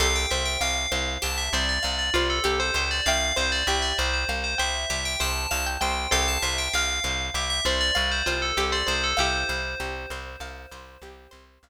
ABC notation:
X:1
M:5/4
L:1/16
Q:1/4=98
K:C
V:1 name="Tubular Bells"
f g e g f4 a e d d d d2 A2 c c d | f2 c d e d c c2 c e2 e g a2 a z g2 | f a e g f4 e e d d d c2 A2 d c A | c16 z4 |]
V:2 name="Pizzicato Strings"
[Ac]8 z2 c4 F2 G c c2 | [eg]8 z2 g4 c2 f g g2 | [Ac]8 z2 c4 F2 G c c2 | [EG]10 z10 |]
V:3 name="Pizzicato Strings"
G2 c2 f2 c2 G2 c2 f2 c2 G2 c2 | f2 c2 G2 c2 f2 c2 G2 c2 f2 c2 | G2 c2 f2 c2 G2 c2 f2 c2 G2 c2 | f2 c2 G2 c2 f2 c2 G2 c2 f2 z2 |]
V:4 name="Electric Bass (finger)" clef=bass
C,,2 C,,2 C,,2 C,,2 C,,2 C,,2 C,,2 C,,2 C,,2 ^C,,2 | C,,2 C,,2 C,,2 C,,2 C,,2 C,,2 C,,2 C,,2 C,,2 C,,2 | C,,2 C,,2 C,,2 C,,2 C,,2 C,,2 C,,2 C,,2 C,,2 C,,2 | C,,2 C,,2 C,,2 C,,2 C,,2 C,,2 C,,2 C,,2 C,,2 z2 |]